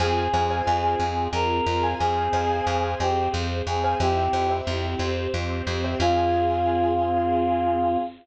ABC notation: X:1
M:6/8
L:1/16
Q:3/8=60
K:Fdor
V:1 name="Choir Aahs"
A4 A4 B4 | A6 G2 z2 A2 | G4 z8 | F12 |]
V:2 name="Acoustic Grand Piano"
[cfa]2 [cfa] [cfa]8 [cfa]- | [cfa]2 [cfa] [cfa]8 [cfa] | [c=eg]2 [ceg] [ceg]8 [ceg] | [CFA]12 |]
V:3 name="Electric Bass (finger)" clef=bass
F,,2 F,,2 F,,2 F,,2 F,,2 F,,2 | F,,2 F,,2 F,,2 F,,2 F,,2 F,,2 | F,,2 F,,2 F,,2 F,,2 F,,2 F,,2 | F,,12 |]
V:4 name="String Ensemble 1"
[CFA]12 | [CAc]12 | [C=EG]6 [CGc]6 | [CFA]12 |]